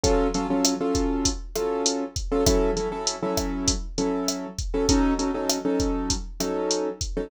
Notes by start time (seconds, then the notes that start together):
0.04 F#3 C#4 F4 A4, kick, closed hi-hat
0.34 F#3 C#4 F4 A4, closed hi-hat
0.50 F#3 C#4 F4 A4
0.65 cross-stick, closed hi-hat
0.81 F#3 C#4 F4 A4
0.95 kick, closed hi-hat
1.25 kick, closed hi-hat
1.56 F#3 C#4 F4 A4, cross-stick, closed hi-hat
1.86 closed hi-hat
2.16 kick, closed hi-hat
2.32 F#3 C#4 F4 A4
2.46 F#3 C#4 E4 A4, kick, cross-stick, closed hi-hat
2.77 F#3 C#4 E4 A4, closed hi-hat
2.92 F#3 C#4 E4 A4
3.07 closed hi-hat
3.23 F#3 C#4 E4 A4
3.37 kick, cross-stick, closed hi-hat
3.68 kick, closed hi-hat
3.98 F#3 C#4 E4 A4, closed hi-hat
4.28 cross-stick, closed hi-hat
4.59 kick, closed hi-hat
4.74 F#3 C#4 E4 A4
4.89 F#3 C#4 D#4 A4, kick, closed hi-hat
5.19 F#3 C#4 D#4 A4, closed hi-hat
5.34 F#3 C#4 D#4 A4
5.49 cross-stick, closed hi-hat
5.65 F#3 C#4 D#4 A4
5.80 kick, closed hi-hat
6.10 kick, closed hi-hat
6.40 F#3 C#4 D#4 A4, cross-stick, closed hi-hat
6.71 closed hi-hat
7.01 kick, closed hi-hat
7.17 F#3 C#4 D#4 A4